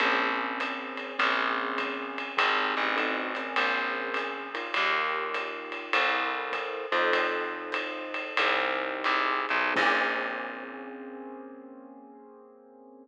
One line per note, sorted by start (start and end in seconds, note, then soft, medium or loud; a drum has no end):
0.00 1.12 A#1 loud
0.00 1.15 A#3 medium
0.00 1.15 C4 loud
0.00 1.15 C#4 medium
0.00 1.15 G#4 medium
0.00 kick soft
0.00 ride medium
0.60 hi-hat pedal medium
0.60 ride medium
0.97 ride medium
1.18 2.31 A#1 loud
1.18 2.36 A#3 medium
1.18 2.36 C4 loud
1.18 2.36 C#4 medium
1.18 2.36 G#4 medium
1.18 ride medium
1.78 kick medium
1.78 hi-hat pedal medium
1.78 ride medium
2.18 ride medium
2.37 2.75 G#1 medium
2.37 2.95 C4 medium
2.37 2.95 D#4 medium
2.37 2.95 G4 medium
2.37 2.95 G#4 loud
2.37 kick medium
2.37 ride loud
2.77 3.54 A1 medium
2.96 3.32 C4 loud
2.96 3.32 D#4 medium
2.96 3.32 F#4 loud
2.96 3.32 A4 medium
2.96 ride medium
3.35 4.48 C4 medium
3.35 4.48 C#4 loud
3.35 4.48 G#4 medium
3.35 4.48 A#4 medium
3.35 hi-hat pedal medium
3.35 ride medium
3.56 4.69 A#1 loud
3.56 ride medium
4.14 hi-hat pedal medium
4.14 ride medium
4.54 5.93 D#4 medium
4.54 5.93 F4 loud
4.54 5.93 G4 medium
4.54 5.93 A#4 loud
4.54 ride medium
4.74 5.89 D#2 loud
4.74 ride medium
5.34 hi-hat pedal medium
5.34 ride medium
5.72 ride medium
5.93 6.86 C2 loud
5.93 6.85 E4 loud
5.93 6.85 A4 loud
5.93 6.85 A#4 medium
5.93 6.85 C5 medium
5.93 ride loud
6.52 kick medium
6.52 hi-hat pedal medium
6.52 ride medium
6.92 8.31 F2 medium
6.92 8.36 D#4 loud
6.92 8.36 F4 medium
6.92 8.36 A4 loud
6.92 8.36 C5 medium
6.92 ride medium
7.13 kick medium
7.13 ride medium
7.72 hi-hat pedal medium
7.72 ride medium
8.14 ride medium
8.37 9.03 C2 medium
8.37 9.76 D#4 loud
8.37 9.76 G4 medium
8.37 9.73 G#4 medium
8.37 9.76 C5 medium
8.37 ride loud
9.04 9.46 C2 medium
9.04 hi-hat pedal medium
9.04 ride medium
9.49 9.73 B1 medium
9.49 ride medium
9.74 13.08 A#1 loud
9.74 13.05 A#3 medium
9.74 13.05 C4 loud
9.74 13.05 C#4 medium
9.74 13.05 G#4 loud
9.74 kick loud
9.74 crash loud